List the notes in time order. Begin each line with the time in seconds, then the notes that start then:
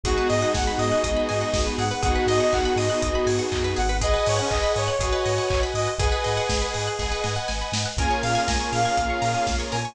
0.04 G#1 G#3 B3 D#4 F#4 G#4, kick, closed hi-hat
0.17 B4
0.30 G#2 D#5, open hi-hat
0.41 D#5 F#5
0.54 G#1 F#5 G#5, kick, snare
0.67 B5
0.78 G#2 D#5 D#6, open hi-hat
0.92 F#6
1.04 G#1 G#3 B3 D#4 G#4 B4 D#6, kick, closed hi-hat
1.17 B5
1.29 G#2 G#5, open hi-hat
1.41 F#5
1.54 G#1 D#5, kick, snare
1.66 B4
1.78 G#2 G#4 F#5, open hi-hat
1.91 B4
2.03 G#1 B3 D#4 F#4 G#4 F#5, kick, closed hi-hat
2.15 B4
2.26 G#2 D#5, open hi-hat
2.40 D#5 F#5
2.52 G#1 F#5 G#5, kick, clap
2.65 B5
2.76 G#2 D#5 D#6, open hi-hat
2.90 F#6
3.02 G#1 B3 D#4 F#4 G#4 B4 D#6, kick, closed hi-hat
3.15 B5
3.26 G#2 G#5, open hi-hat
3.39 F#5
3.52 F#2 D#5, kick, clap
3.64 B4
3.76 G#1 G#4 F#5, open hi-hat
3.89 B4
4.01 G#4 B4 D#5 F#5 G#5, kick, closed hi-hat
4.14 B4
4.26 G#2 C#5 D#5, open hi-hat
4.39 C#4 F#5
4.50 G#1 D#5 G#5, kick, clap
4.63 B5
4.76 G#2 C#5 D#6, open hi-hat
4.88 F#6
4.99 G#1 F#4 G#4 B4 D#5 F#5 G#5, kick, closed hi-hat
5.12 B4
5.26 G#2 D#5, open hi-hat
5.38 F#5
5.50 G#1 G#5, kick, clap
5.63 B5
5.74 G#2 D#5 D#6, open hi-hat
5.88 F#6
5.98 G#1 G#4 B4 D#5 F#5 G#5, kick, closed hi-hat
6.12 B4
6.24 G#2 D#5, open hi-hat
6.37 F#5
6.49 G#1 G#5, kick, snare
6.62 B5
6.74 G#2 D#6, open hi-hat
6.87 F#6
6.99 G#1 G#4 B4 D#5 F#5 G#5, kick, snare
7.12 B4
7.24 G#2 D#5, snare
7.36 F#5
7.48 G#1 G#5, snare
7.61 B5
7.72 G#2 D#6, snare
7.86 F#6
7.97 A#1 A#3 C#4 F4 G#4 A#4 G#5, kick, closed hi-hat
8.11 C#5
8.23 A#2 F5, open hi-hat
8.35 F5 G#5
8.48 A#1 G#5 A#5, kick, snare
8.60 C#6
8.72 A#2 F5 F6, open hi-hat
8.85 G#6
8.97 A#1 A#3 C#4 F4 A#4 C#5 F6, kick, closed hi-hat
9.10 C#6
9.22 A#2 A#5, open hi-hat
9.35 G#5
9.47 A#1 F5, kick, snare
9.60 C#5
9.72 A#2 A#4 G#5, open hi-hat
9.85 C#5